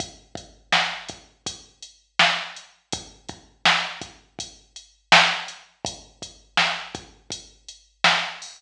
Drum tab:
HH |xx-xxx-x|xx-xxx-x|xx-xxx-o|
SD |--o---o-|--o---o-|--o---o-|
BD |oo-oo---|oo-oo---|oo-oo---|